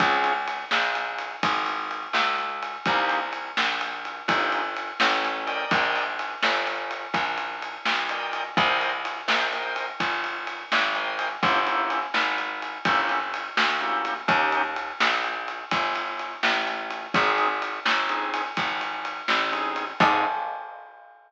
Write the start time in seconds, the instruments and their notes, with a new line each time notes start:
0.00 electric bass (finger) C#2, drawbar organ C4 C#4 F4 G#4, kick, ride
0.24 ride
0.48 ride
0.71 electric bass (finger) A#1, snare
0.95 ride
1.18 ride
1.43 electric bass (finger) G#1, kick, ride
1.66 ride
1.91 ride
2.13 electric bass (finger) C#2, snare
2.38 ride
2.62 ride
2.86 electric bass (finger) C2, drawbar organ A#3 C4 D#4 G4, kick, ride
3.09 ride
3.33 ride
3.57 electric bass (finger) A#1, snare
3.81 ride
4.05 ride
4.28 electric bass (finger) G1, drawbar organ A#3 C4 D#4 G4, kick, ride
4.52 ride
4.76 ride
5.00 electric bass (finger) A1, snare
5.25 ride
5.47 drawbar organ A#4 D5 D#5 G5, ride
5.71 electric bass (finger) A#1, kick, ride
5.96 ride
6.19 ride
6.43 electric bass (finger) G1, snare
6.67 ride
6.91 ride
7.14 electric bass (finger) A#1, kick, ride
7.38 ride
7.62 ride
7.85 electric bass (finger) B1, snare
8.09 drawbar organ A#4 D5 D#5 G5, ride
8.33 ride
8.57 electric bass (finger) C2, drawbar organ A#4 C5 D#5 G5, kick, ride
8.81 ride
9.05 ride
9.28 electric bass (finger) A#1, drawbar organ A#4 C5 D#5 G5, snare
9.52 drawbar organ A#4 C5 D#5 G5, ride
9.76 ride
10.00 electric bass (finger) G1, kick, ride
10.24 ride
10.47 ride
10.72 electric bass (finger) G#1, snare
10.95 drawbar organ A#4 C5 D#5 G5, ride
11.19 ride
11.43 electric bass (finger) G1, drawbar organ A#3 C#4 E4 G4, kick, ride
11.67 drawbar organ A#3 C#4 E4 G4, ride
11.90 ride
12.14 electric bass (finger) G#1, snare
12.38 ride
12.62 ride
12.85 electric bass (finger) G1, drawbar organ A#3 C#4 E4 G4, kick, ride
13.09 ride
13.34 ride
13.57 electric bass (finger) D2, snare
13.81 drawbar organ A#3 C#4 E4 G4, ride
14.05 ride
14.28 electric bass (finger) D#2, drawbar organ A#3 C#4 D#4 G4, kick, ride
14.52 ride
14.76 ride
15.00 electric bass (finger) A#1, snare
15.24 ride
15.48 ride
15.71 electric bass (finger) G1, kick, ride
15.95 ride
16.19 ride
16.43 electric bass (finger) A1, snare
16.67 ride
16.90 ride
17.14 electric bass (finger) G#1, drawbar organ C4 D#4 G#4, kick, ride
17.38 ride
17.62 ride
17.85 electric bass (finger) G1, snare
18.09 drawbar organ C4 D#4 G#4, ride
18.34 ride
18.57 electric bass (finger) G#1, kick, ride
18.81 ride
19.05 ride
19.28 electric bass (finger) A1, snare
19.52 drawbar organ C4 D#4 G#4, ride
19.76 ride
20.00 electric bass (finger) G#2, drawbar organ C4 D#4 G#4, kick, crash